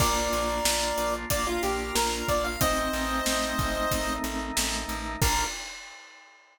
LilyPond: <<
  \new Staff \with { instrumentName = "Lead 1 (square)" } { \time 4/4 \key bes \major \tempo 4 = 92 <bes' d''>2 d''16 f'16 g'8 bes'8 d''16 f''16 | <c'' ees''>2~ <c'' ees''>8 r4. | bes'4 r2. | }
  \new Staff \with { instrumentName = "Acoustic Grand Piano" } { \time 4/4 \key bes \major <bes d' f'>4 <bes d' f'>4 <bes d' f'>4 <bes d' f'>4 | <a c' ees'>4 <a c' ees'>4 <a c' ees'>4 <a c' ees'>4 | <bes d' f'>4 r2. | }
  \new Staff \with { instrumentName = "Electric Bass (finger)" } { \clef bass \time 4/4 \key bes \major bes,,8 bes,,8 bes,,8 bes,,8 bes,,8 bes,,8 bes,,8 bes,,8 | a,,8 a,,8 a,,8 a,,8 a,,8 a,,8 a,,8 a,,8 | bes,,4 r2. | }
  \new Staff \with { instrumentName = "Drawbar Organ" } { \time 4/4 \key bes \major <bes d' f'>2 <bes f' bes'>2 | <a c' ees'>2 <ees a ees'>2 | <bes d' f'>4 r2. | }
  \new DrumStaff \with { instrumentName = "Drums" } \drummode { \time 4/4 <cymc bd>8 hh8 sn8 hh8 <hh bd>8 hh8 sn8 <hh bd>8 | <hh bd>8 hh8 sn8 <hh bd>8 <hh bd>8 hh8 sn8 hh8 | <cymc bd>4 r4 r4 r4 | }
>>